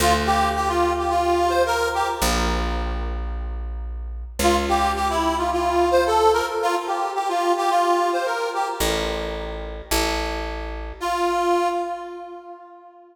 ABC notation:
X:1
M:4/4
L:1/16
Q:1/4=109
K:Dm
V:1 name="Accordion"
F z G2 G F2 G F3 c B2 G z | z16 | F z G2 G E2 F F3 c A2 B z | F z G2 G F2 G F3 c B2 G z |
z16 | F6 z10 |]
V:2 name="Electric Bass (finger)" clef=bass
D,,16 | B,,,16 | ^C,,16 | z16 |
A,,,8 A,,,8 | z16 |]